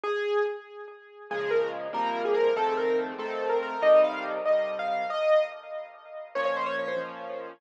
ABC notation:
X:1
M:6/8
L:1/16
Q:3/8=95
K:Bbm
V:1 name="Acoustic Grand Piano"
A4 z8 | A2 B2 z2 B3 A B2 | =A2 B2 z2 A3 B B2 | e2 f2 z2 e3 f f2 |
e4 z8 | d d c d d c z6 |]
V:2 name="Acoustic Grand Piano"
z12 | [B,,D,F,A,]6 [C,F,=G,B,]6 | [F,,E,=A,C]6 [F,,E,A,C]6 | [C,E,=G,]6 [C,E,G,]6 |
z12 | [B,,F,D]6 [B,,F,D]6 |]